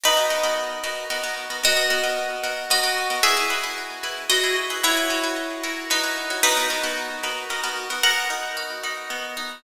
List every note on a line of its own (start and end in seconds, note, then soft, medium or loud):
0.04 0.14 B3 medium
0.04 0.54 D#4 medium
0.04 0.14 F#4 medium
0.04 0.14 A#4 medium
0.04 0.54 B4 medium
0.04 0.14 D#5 medium
0.17 0.28 B3 medium
0.17 0.28 F#4 medium
0.17 0.28 A#4 medium
0.17 0.28 D#5 medium
0.30 0.41 B3 medium
0.30 0.41 F#4 medium
0.30 0.41 A#4 medium
0.30 0.41 D#5 medium
0.43 0.75 B3 medium
0.43 0.75 F#4 medium
0.43 0.75 A#4 medium
0.43 0.75 D#5 medium
0.84 1.05 B3 medium
0.84 1.05 F#4 medium
0.84 1.05 A#4 medium
0.84 1.05 D#5 medium
1.10 1.21 B3 medium
1.10 1.21 F#4 medium
1.10 1.21 A#4 medium
1.10 1.21 D#5 medium
1.24 1.45 B3 medium
1.24 1.45 F#4 medium
1.24 1.45 A#4 medium
1.24 1.45 D#5 medium
1.50 1.61 B3 medium
1.50 1.61 F#4 medium
1.50 1.61 A#4 medium
1.50 1.61 D#5 medium
1.64 1.74 B3 medium
1.64 2.54 F#4 medium
1.64 1.74 A#4 medium
1.64 2.54 D#5 loud
1.77 1.88 B3 medium
1.77 1.88 F#4 medium
1.77 1.88 A#4 medium
1.77 1.88 D#5 medium
1.90 2.01 B3 medium
1.90 2.01 F#4 medium
1.90 2.01 A#4 medium
1.90 2.01 D#5 medium
2.04 2.36 B3 medium
2.04 2.36 F#4 medium
2.04 2.36 A#4 medium
2.04 2.36 D#5 medium
2.44 2.65 B3 medium
2.44 2.65 F#4 medium
2.44 2.65 A#4 medium
2.44 2.65 D#5 medium
2.70 2.81 B3 medium
2.70 3.16 F#4 medium
2.70 2.81 A#4 medium
2.70 3.16 D#5 medium
2.84 3.05 B3 medium
2.84 3.05 F#4 medium
2.84 3.05 A#4 medium
2.84 3.05 D#5 medium
3.10 3.21 B3 medium
3.10 3.21 F#4 medium
3.10 3.21 A#4 medium
3.10 3.21 D#5 medium
3.23 3.34 E4 medium
3.23 4.26 G#4 medium
3.23 3.34 B4 medium
3.23 4.26 E5 loud
3.37 3.48 E4 medium
3.37 3.48 G#4 medium
3.37 3.48 B4 medium
3.50 3.61 E4 medium
3.50 3.61 G#4 medium
3.50 3.61 B4 medium
3.64 3.96 E4 medium
3.64 3.96 G#4 medium
3.64 3.96 B4 medium
4.04 4.25 E4 medium
4.04 4.25 G#4 medium
4.04 4.25 B4 medium
4.30 4.41 E4 medium
4.30 4.56 F#4 medium
4.30 4.41 B4 medium
4.30 4.56 D#5 medium
4.44 4.65 E4 medium
4.44 4.65 G#4 medium
4.44 4.65 B4 medium
4.70 4.81 E4 medium
4.70 4.81 G#4 medium
4.70 4.81 B4 medium
4.83 5.76 E4 medium
4.83 4.94 F#4 medium
4.83 4.94 B4 loud
4.83 5.76 C#5 medium
4.97 5.08 F#4 medium
4.97 5.08 B4 medium
4.97 5.08 C#5 medium
5.10 5.21 F#4 medium
5.10 5.21 B4 medium
5.10 5.21 C#5 medium
5.24 5.56 F#4 medium
5.24 5.56 B4 medium
5.24 5.56 C#5 medium
5.64 5.85 F#4 medium
5.64 5.85 A#4 medium
5.64 5.85 C#5 medium
5.90 6.40 D#4 medium
5.90 6.01 F#4 medium
5.90 6.40 B4 medium
5.90 6.01 C#5 medium
6.04 6.25 F#4 medium
6.04 6.25 A#4 medium
6.04 6.25 C#5 medium
6.30 6.41 F#4 medium
6.30 6.41 A#4 medium
6.30 6.41 C#5 medium
6.43 6.54 B3 medium
6.43 6.92 D#4 loud
6.43 6.54 F#4 medium
6.43 6.54 A#4 medium
6.43 6.92 B4 loud
6.57 6.68 B3 medium
6.57 6.68 F#4 medium
6.57 6.68 A#4 medium
6.57 6.68 D#5 medium
6.70 6.81 B3 medium
6.70 6.81 F#4 medium
6.70 6.81 A#4 medium
6.70 6.81 D#5 medium
6.84 7.16 B3 medium
6.84 7.16 F#4 medium
6.84 7.16 A#4 medium
6.84 7.16 D#5 medium
7.24 7.45 B3 medium
7.24 7.45 F#4 medium
7.24 7.45 A#4 medium
7.24 7.45 D#5 medium
7.50 7.61 B3 medium
7.50 7.61 F#4 medium
7.50 7.61 A#4 medium
7.50 7.61 D#5 medium
7.64 7.85 B3 medium
7.64 7.85 F#4 medium
7.64 7.85 A#4 medium
7.64 7.85 D#5 medium
7.90 8.01 B3 medium
7.90 8.01 F#4 medium
7.90 8.01 A#4 medium
7.90 8.01 D#5 medium
8.03 9.10 B3 loud
8.03 8.95 A#4 medium
8.03 8.95 F#5 medium
8.30 8.83 D#4 medium
8.57 9.58 F#4 medium
8.84 9.36 D#4 medium
9.10 9.61 B3 medium
9.37 9.62 D#4 medium